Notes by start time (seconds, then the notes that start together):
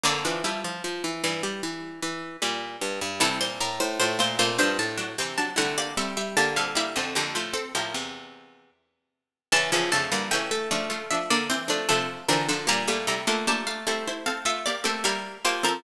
0.03 F2 D3 A#3 D5
0.25 E3 F3 D4
0.44 F3 G3 E4
0.64 F3
0.84 F3
1.04 E3
1.24 G2 E3
1.43 G3
1.63 E3
2.02 E3
2.42 A#2 G3
2.81 G2
3.01 G2
3.20 G2 C3 E3 G3 E4 A4
3.41 A#2 C5
3.60 A2 A#4
3.80 A2 C5
4.00 A2 A3 F4 C5
4.19 A#2 A3 F4 C5
4.39 A#2 C3 A3 F4 C5
4.58 G2 F3 D4 C5
4.79 A2 A5
4.98 F#3 D4
5.18 C3 E3 C4 G5
5.38 F#3 D4 A5
5.56 C3 D3 G3 A3 E4 F#5
5.78 A#3 G4 D5
5.97 G3 C4 A4 E5
6.17 G3 E5
6.37 D3 A#3 G4 A5
6.56 A#2 G3 C4 A4 F5
6.75 G3 A#3 E4 G4 E5
6.96 F2 D3 C4 A4
7.15 F2 D3 A#3 G4
7.35 A2 F3 A3 F4
7.53 C4 A4
7.75 A2 F3 A#3 G4
7.94 E2 C3
9.52 E2 C#3 E3 C#4 A5
9.72 E2 C#3 E3 F3 C#4
9.92 F2 C#3 D3 A3 A5
10.12 G2 D3 E3 G3 A#3
10.31 C#3 E3 A3 C#4 G5
10.51 A3 E5
10.71 C#3 F3 A3 D4
10.90 A3 F4
11.11 F3 D4 E5
11.30 D3 A#3 D5
11.50 E3 C4 C5
11.68 F3 A3 D4
11.89 C3 F3 A3 D4 A4
12.28 D3 E3 F3 C4 D4 A#4
12.49 D3 F3 D4 A4
12.67 A#2 G3 A#3 G4 A#5
12.88 A#2 G3 A3 A#3 G4
13.07 C3 G3 A3 E4 A#5
13.27 D3 A3 A#3 F4
13.47 F3 A3 A#3 D4 G4 A5
13.67 A3 F5
13.87 G3 A3 C4 E4 A4
14.07 E4 C5
14.26 C4 A4 F5
14.45 A3 F4 E5
14.66 A#3 G4 D5
14.84 A3 A#3 C4 G4 A4
15.04 G3 A#3 E4 G4 A#4
15.45 F3 A#3 G4 C5
15.63 F3 C4 A4 A#4